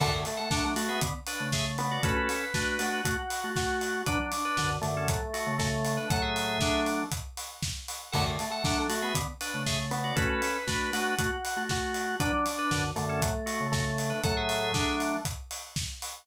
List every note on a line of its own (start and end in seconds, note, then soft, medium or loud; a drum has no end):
0.00 0.12 F#2 medium
0.00 0.12 D3 medium
0.00 0.22 A3 loud
0.00 0.12 A4 medium
0.00 0.12 F#5 loud
0.00 kick loud
0.00 crash loud
0.13 0.25 F#2 medium
0.13 0.25 D3 medium
0.25 0.38 A3 medium
0.25 open hi-hat medium
0.37 0.49 A3 medium
0.37 0.49 A4 medium
0.37 0.49 F#5 medium
0.50 0.74 F#3 medium
0.50 0.62 A3 medium
0.50 0.74 D4 medium
0.50 0.64 A4 medium
0.50 0.64 F#5 medium
0.50 kick loud
0.50 snare loud
0.64 0.89 A3 loud
0.76 1.00 A3 medium
0.76 1.00 F#4 medium
0.76 open hi-hat loud
0.88 1.01 B3 medium
0.88 1.01 G#4 medium
0.88 1.01 E5 medium
1.01 1.14 D3 medium
1.01 1.14 B3 medium
1.01 kick loud
1.01 closed hi-hat loud
1.26 1.50 D4 medium
1.26 1.50 B4 medium
1.26 open hi-hat loud
1.40 1.98 C#3 medium
1.40 1.98 A3 medium
1.52 1.65 G#4 medium
1.52 1.65 E5 medium
1.52 kick medium
1.52 snare loud
1.78 2.01 B3 medium
1.78 open hi-hat medium
1.91 2.03 F#4 medium
1.91 2.03 D5 medium
2.03 2.16 A3 medium
2.03 2.45 C#4 medium
2.03 2.16 F#4 medium
2.03 2.45 A4 loud
2.03 2.79 B4 loud
2.03 kick loud
2.03 closed hi-hat loud
2.17 2.29 A3 medium
2.17 2.29 F#4 medium
2.29 open hi-hat medium
2.54 2.78 A3 medium
2.54 3.00 D4 medium
2.54 2.78 F#4 medium
2.54 3.00 B4 medium
2.54 kick loud
2.54 snare loud
2.79 3.02 A3 medium
2.79 3.02 F#4 medium
2.79 3.50 F#4 medium
2.79 open hi-hat loud
3.05 3.17 A3 medium
3.05 3.17 F#4 medium
3.05 kick loud
3.05 closed hi-hat loud
3.30 open hi-hat loud
3.44 4.03 A3 medium
3.44 4.03 F#4 medium
3.56 4.02 F#4 medium
3.56 kick loud
3.56 snare loud
3.81 open hi-hat medium
4.06 4.19 F#3 medium
4.06 4.18 D4 medium
4.06 4.19 D4 medium
4.06 4.71 D4 medium
4.06 4.18 B4 medium
4.06 kick loud
4.06 closed hi-hat loud
4.19 4.32 F#3 medium
4.19 4.32 D4 medium
4.32 open hi-hat loud
4.45 4.57 D4 medium
4.45 4.57 B4 medium
4.57 4.78 F#2 medium
4.57 4.78 D3 medium
4.57 4.70 D4 medium
4.57 4.70 B4 medium
4.57 kick medium
4.57 snare loud
4.82 5.08 F#2 medium
4.82 5.08 D3 medium
4.82 5.52 A3 medium
4.82 open hi-hat medium
4.97 5.09 C#4 medium
4.97 5.09 A4 medium
5.08 5.21 A2 medium
5.08 5.21 F#3 medium
5.08 kick loud
5.08 closed hi-hat loud
5.33 5.55 A3 medium
5.33 5.55 F#4 medium
5.33 open hi-hat medium
5.47 5.99 C#3 medium
5.47 5.99 A3 medium
5.58 5.70 A3 medium
5.58 6.08 A3 medium
5.58 5.70 F#4 medium
5.58 kick loud
5.58 snare loud
5.85 open hi-hat medium
5.97 6.09 D4 medium
5.97 6.09 B4 medium
6.10 6.58 A2 medium
6.10 6.58 F#3 loud
6.10 7.04 A3 medium
6.10 6.22 A4 medium
6.10 6.22 F#5 medium
6.10 kick loud
6.10 closed hi-hat loud
6.22 6.80 G#4 medium
6.22 6.80 E5 medium
6.36 open hi-hat medium
6.61 7.03 F#3 medium
6.61 7.03 D4 medium
6.61 kick loud
6.61 snare loud
6.86 open hi-hat medium
7.12 kick loud
7.12 closed hi-hat loud
7.37 open hi-hat medium
7.63 kick loud
7.63 snare loud
7.88 open hi-hat loud
8.12 8.25 F#2 medium
8.12 8.25 D3 medium
8.12 8.36 A3 loud
8.12 8.24 A4 medium
8.12 8.24 F#5 loud
8.12 kick loud
8.12 crash loud
8.26 8.38 F#2 medium
8.26 8.38 D3 medium
8.39 8.50 A3 medium
8.39 open hi-hat medium
8.50 8.63 A3 medium
8.50 8.63 A4 medium
8.50 8.63 F#5 medium
8.64 8.87 F#3 medium
8.64 8.77 A3 medium
8.64 8.87 D4 medium
8.64 8.77 A4 medium
8.64 8.77 F#5 medium
8.64 kick loud
8.64 snare loud
8.78 9.02 A3 loud
8.89 9.13 A3 medium
8.89 9.13 F#4 medium
8.89 open hi-hat loud
9.02 9.15 B3 medium
9.02 9.14 G#4 medium
9.02 9.14 E5 medium
9.15 9.27 D3 medium
9.15 9.27 B3 medium
9.15 kick loud
9.15 closed hi-hat loud
9.41 9.63 D4 medium
9.41 9.63 B4 medium
9.41 open hi-hat loud
9.54 10.13 C#3 medium
9.54 10.13 A3 medium
9.66 9.78 G#4 medium
9.66 9.78 E5 medium
9.66 kick medium
9.66 snare loud
9.91 10.14 B3 medium
9.91 open hi-hat medium
10.04 10.16 F#4 medium
10.04 10.16 D5 medium
10.16 10.29 A3 medium
10.16 10.57 C#4 medium
10.16 10.29 F#4 medium
10.16 10.57 A4 loud
10.16 10.90 B4 loud
10.16 kick loud
10.16 closed hi-hat loud
10.29 10.41 A3 medium
10.29 10.41 F#4 medium
10.42 open hi-hat medium
10.67 10.91 A3 medium
10.67 11.15 D4 medium
10.67 10.91 F#4 medium
10.67 11.15 B4 medium
10.67 kick loud
10.67 snare loud
10.93 11.15 A3 medium
10.93 11.15 F#4 medium
10.93 11.63 F#4 medium
10.93 open hi-hat loud
11.19 11.31 A3 medium
11.19 11.31 F#4 medium
11.19 kick loud
11.19 closed hi-hat loud
11.45 open hi-hat loud
11.56 12.15 A3 medium
11.56 12.15 F#4 medium
11.69 12.16 F#4 medium
11.69 kick loud
11.69 snare loud
11.94 open hi-hat medium
12.20 12.32 F#3 medium
12.20 12.32 D4 medium
12.20 12.85 D4 medium
12.20 12.32 B4 medium
12.20 kick loud
12.20 closed hi-hat loud
12.33 12.45 F#3 medium
12.33 12.45 D4 medium
12.46 open hi-hat loud
12.58 12.71 D4 medium
12.58 12.71 B4 medium
12.71 12.92 F#2 medium
12.71 12.92 D3 medium
12.71 12.83 D4 medium
12.71 12.83 B4 medium
12.71 kick medium
12.71 snare loud
12.96 13.21 F#2 medium
12.96 13.21 D3 medium
12.96 13.66 A3 medium
12.96 open hi-hat medium
13.09 13.21 C#4 medium
13.09 13.21 A4 medium
13.22 13.34 A2 medium
13.22 13.34 F#3 medium
13.22 kick loud
13.22 closed hi-hat loud
13.46 13.67 A3 medium
13.46 13.67 F#4 medium
13.46 open hi-hat medium
13.60 14.13 C#3 medium
13.60 14.13 A3 medium
13.72 14.20 A3 medium
13.72 13.84 A3 medium
13.72 13.84 F#4 medium
13.72 kick loud
13.72 snare loud
13.98 open hi-hat medium
14.10 14.22 D4 medium
14.10 14.22 B4 medium
14.24 14.72 A2 medium
14.24 14.72 F#3 loud
14.24 15.19 A3 medium
14.24 14.36 A4 medium
14.24 14.36 F#5 medium
14.24 kick loud
14.24 closed hi-hat loud
14.37 14.95 G#4 medium
14.37 14.95 E5 medium
14.49 open hi-hat medium
14.74 15.16 F#3 medium
14.74 15.16 D4 medium
14.74 kick loud
14.74 snare loud
15.00 open hi-hat medium
15.25 kick loud
15.25 closed hi-hat loud
15.51 open hi-hat medium
15.76 kick loud
15.76 snare loud
16.02 open hi-hat loud